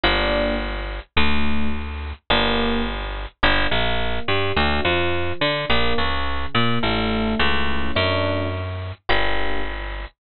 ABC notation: X:1
M:4/4
L:1/8
Q:1/4=106
K:Gm
V:1 name="Electric Piano 1"
[B,DG]2 z2 | [A,D^F]2 z2 [B,DG]2 z2 | [B,DG] B,2 G, [A,D^F] =F,2 D | [B,DG] ^C,2 B, [A,D=E]2 [A,^CE]2 |
[A,D^F]2 z2 [B,DG]2 z2 |]
V:2 name="Electric Bass (finger)" clef=bass
G,,,4 | D,,4 G,,,4 | G,,, B,,,2 G,, D,, F,,2 D, | B,,, ^C,,2 B,, A,,,2 C,,2 |
^F,,4 G,,,4 |]